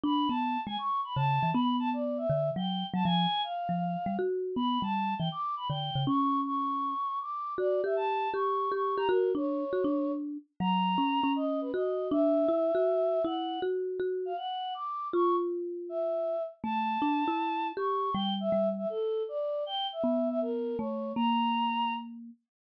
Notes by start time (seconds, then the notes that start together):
0.04 D4 B5
0.29 B3 A5
0.66 G#3 G#5
0.78 C#6
1.04 B5
1.16 C#3 A5
1.43 E3
1.54 B3 B5
1.79 A5
1.93 D5
2.18 E5
2.30 D3
2.56 F#3 G5
2.94 F#3 A5
3.05 F3 G#5
3.44 F5
3.69 F3
4.06 G3
4.19 F#4
4.56 B3 B5
4.82 G3 A5
5.19 E3 G5
5.32 D6
5.57 B5
5.69 D3 G5
5.95 C#3
6.07 C#4 C#6
6.46 C#6
7.21 D6
7.58 F#4 D5
7.84 G4 E5
7.96 A5
8.34 G4 C#6
8.72 G4 C#6
8.97 G4 A#5
9.09 F#4 A#4
9.35 D4 C#5
9.73 F#4
9.84 D4
10.60 F#3 A#5
10.98 C#4
11.24 C#4
11.36 D#5
11.61 B4
11.74 F#4 D#5
12.11 D4 E5
12.49 E4
12.75 F#4
13.25 E4 F#5
13.62 F#4
14.00 F#4
14.25 F5
14.37 F#5
14.74 D6
15.13 F4 C#6
15.89 E5
16.64 A3 A5
17.02 D4
17.28 E4
17.77 G4 C#6
18.14 G3 G5
18.40 E5
18.52 G3
18.78 E5
18.90 A4
19.29 D5
19.66 G5
19.92 E5
20.04 B3
20.30 E5
20.42 A#4
20.78 A3 C#5
21.16 A#3 A#5